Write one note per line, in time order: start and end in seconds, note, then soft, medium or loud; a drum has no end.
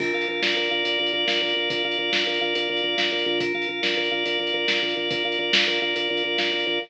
0.00 0.12 A#1 medium
0.00 0.28 A#4 loud
0.00 kick medium
0.00 crash medium
0.14 0.26 A#1 medium
0.14 0.70 F5 medium
0.21 closed hi-hat medium
0.28 0.41 A#1 medium
0.28 0.56 A#4 medium
0.42 0.54 A#1 medium
0.42 0.85 D5 medium
0.42 snare loud
0.57 0.69 A#1 medium
0.57 0.99 A#4 loud
0.64 closed hi-hat medium
0.71 0.83 A#1 medium
0.71 1.27 F5 medium
0.85 0.97 A#1 medium
0.85 1.56 D5 medium
0.85 closed hi-hat medium
0.99 1.12 A#1 medium
0.99 1.13 A#4 medium
1.06 closed hi-hat medium
1.13 1.25 A#1 medium
1.13 1.41 A#4 medium
1.28 1.40 A#1 medium
1.28 1.84 F5 medium
1.28 snare medium
1.41 1.53 A#1 medium
1.41 1.70 A#4 medium
1.49 closed hi-hat medium
1.56 1.68 A#1 medium
1.56 1.98 D5 medium
1.70 1.82 A#1 medium
1.70 2.12 A#4 medium
1.70 kick medium
1.70 closed hi-hat loud
1.84 1.96 A#1 medium
1.84 2.41 F5 medium
1.92 closed hi-hat medium
1.98 2.10 A#1 medium
1.98 2.69 D5 medium
2.12 2.24 A#1 medium
2.12 2.26 A#4 medium
2.12 snare loud
2.27 2.39 A#1 medium
2.27 2.55 A#4 medium
2.34 closed hi-hat medium
2.41 2.53 A#1 medium
2.41 2.97 F5 medium
2.55 2.67 A#1 medium
2.55 2.83 A#4 medium
2.55 closed hi-hat medium
2.69 2.81 A#1 medium
2.69 3.12 D5 medium
2.77 closed hi-hat medium
2.83 2.95 A#1 medium
2.83 3.26 A#4 medium
2.98 3.11 A#1 medium
2.98 3.38 F5 medium
2.98 snare loud
3.12 3.24 A#1 medium
3.12 3.39 D5 medium
3.19 closed hi-hat medium
3.26 3.52 A#1 medium
3.26 3.40 A#4 medium
3.40 3.68 A#4 medium
3.40 kick medium
3.40 closed hi-hat loud
3.54 3.66 A#1 medium
3.54 4.11 F5 medium
3.62 closed hi-hat medium
3.69 3.81 A#1 medium
3.69 3.97 A#4 medium
3.83 3.95 A#1 medium
3.83 4.25 D5 medium
3.83 snare loud
3.97 4.09 A#1 medium
3.97 4.39 A#4 medium
4.04 closed hi-hat medium
4.11 4.24 A#1 medium
4.11 4.68 F5 medium
4.26 4.38 A#1 medium
4.26 4.96 D5 medium
4.26 closed hi-hat medium
4.40 4.52 A#1 medium
4.40 4.53 A#4 medium
4.47 closed hi-hat medium
4.54 4.66 A#1 medium
4.54 4.82 A#4 medium
4.68 4.80 A#1 medium
4.68 5.24 F5 medium
4.68 snare loud
4.82 4.94 A#1 medium
4.82 5.10 A#4 medium
4.89 closed hi-hat medium
4.96 5.09 A#1 medium
4.96 5.39 D5 medium
5.11 5.23 A#1 medium
5.11 5.53 A#4 medium
5.11 kick loud
5.11 closed hi-hat loud
5.25 5.37 A#1 medium
5.25 5.81 F5 medium
5.32 closed hi-hat medium
5.39 5.51 A#1 medium
5.39 6.09 D5 medium
5.53 5.65 A#1 medium
5.53 5.67 A#4 medium
5.53 snare loud
5.67 5.79 A#1 medium
5.67 5.95 A#4 medium
5.74 closed hi-hat medium
5.82 5.94 A#1 medium
5.82 6.38 F5 medium
5.96 6.08 A#1 medium
5.96 6.24 A#4 medium
5.96 closed hi-hat medium
6.10 6.22 A#1 medium
6.10 6.52 D5 medium
6.17 closed hi-hat medium
6.24 6.37 A#1 medium
6.24 6.66 A#4 medium
6.38 6.51 A#1 medium
6.38 6.79 F5 medium
6.38 snare medium
6.52 6.65 A#1 medium
6.52 6.79 D5 medium
6.60 closed hi-hat medium
6.67 6.79 A#1 medium
6.67 6.80 A#4 medium